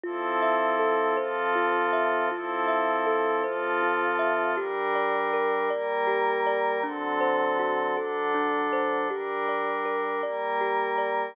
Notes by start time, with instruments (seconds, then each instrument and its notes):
0.04 pad 5 (bowed) F3 C4 E4 A4, kalimba F4
0.42 kalimba E5
0.79 kalimba A4
1.17 pad 5 (bowed) F3 C4 F4 A4, kalimba C5
1.55 kalimba F4
1.93 kalimba E5
2.31 pad 5 (bowed) F3 C4 E4 A4, kalimba F4
2.68 kalimba E5
3.07 kalimba A4
3.44 pad 5 (bowed) F3 C4 F4 A4, kalimba C5
3.83 kalimba F4
4.19 kalimba E5
4.57 pad 5 (bowed) G3 D4 A#4, kalimba G4
4.95 kalimba D5
5.33 kalimba A#4
5.70 pad 5 (bowed) G3 A#3 A#4, kalimba D5
6.07 kalimba G4
6.47 kalimba D5
6.83 pad 5 (bowed) D3 F#3 C4 A4, kalimba D4
7.21 kalimba C5
7.59 kalimba F#4
7.96 pad 5 (bowed) D3 F#3 D4 A4, kalimba A4
8.35 kalimba D4
8.73 kalimba C5
9.09 pad 5 (bowed) G3 D4 A#4, kalimba G4
9.49 kalimba D5
9.86 kalimba A#4
10.23 pad 5 (bowed) G3 A#3 A#4, kalimba D5
10.61 kalimba G4
10.98 kalimba D5